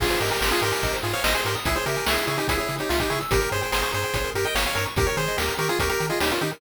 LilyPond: <<
  \new Staff \with { instrumentName = "Lead 1 (square)" } { \time 4/4 \key aes \major \tempo 4 = 145 <f' aes'>8 <g' bes'>16 <g' bes'>16 <g' bes'>16 <f' aes'>16 <g' bes'>4 <f' aes'>16 <des'' f''>16 <c'' ees''>16 <aes' c''>16 <g' bes'>16 r16 | <fes' aes'>16 <aes' c''>16 <g' bes'>8 <fes' aes'>8 <fes' aes'>16 <ees' g'>16 <fes' aes'>16 <fes' aes'>8 <ees' g'>16 f'16 <ees' g'>16 <fes' aes'>16 r16 | <g' bes'>8 <aes' c''>16 <aes' c''>16 <aes' c''>16 <aes' c''>16 <aes' c''>4 <g' bes'>16 <ees'' g''>16 <des'' f''>16 <des'' f''>16 <bes' des''>16 r16 | <g' bes'>16 <bes' des''>16 <aes' c''>8 <g' bes'>8 <g' bes'>16 <f' aes'>16 <g' bes'>16 <g' bes'>8 <f' aes'>16 <ees' g'>16 <des' f'>16 <ees' g'>16 r16 | }
  \new Staff \with { instrumentName = "Lead 1 (square)" } { \time 4/4 \key aes \major aes'16 c''16 ees''16 aes''16 c'''16 ees'''16 c'''16 aes''16 ees''16 c''16 aes'16 c''16 ees''16 aes''16 c'''16 ees'''16 | aes'16 des''16 fes''16 aes''16 des'''16 fes'''16 des'''16 aes''16 fes''16 des''16 aes'16 des''16 fes''16 aes''16 des'''16 fes'''16 | g'16 bes'16 des''16 g''16 bes''16 des'''16 bes''16 g''16 des''16 bes'16 g'16 bes'16 des''16 g''16 bes''16 des'''16 | g'16 bes'16 des''16 ees''16 g''16 bes''16 des'''16 ees'''16 des'''16 bes''16 g''16 ees''16 des''16 bes'16 g'16 bes'16 | }
  \new Staff \with { instrumentName = "Synth Bass 1" } { \clef bass \time 4/4 \key aes \major aes,,8 aes,8 aes,,8 aes,8 aes,,8 aes,8 aes,,8 aes,8 | des,8 des8 des,8 des8 des,8 des8 des,8 des8 | g,,8 g,8 g,,8 g,8 g,,8 g,8 g,,8 g,8 | ees,8 ees8 ees,8 ees8 ees,8 ees8 ees,8 ees8 | }
  \new DrumStaff \with { instrumentName = "Drums" } \drummode { \time 4/4 <cymc bd>16 hh16 hh16 hh16 sn16 hh16 hh16 hh16 <hh bd>16 hh16 hh16 hh16 sn16 hh16 hh16 hh16 | <hh bd>16 hh16 hh16 hh16 sn16 hh16 hh16 hh16 <hh bd>16 hh16 hh16 hh16 sn16 <hh bd>16 hh16 hh16 | <hh bd>16 hh16 hh16 hh16 sn16 hh16 hh16 hh16 <hh bd>16 hh16 hh16 hh16 sn16 hh16 hh16 hh16 | <hh bd>16 hh16 hh16 hh16 sn16 hh16 hh16 hh16 <hh bd>16 hh16 hh16 hh16 sn16 hh16 hh16 hh16 | }
>>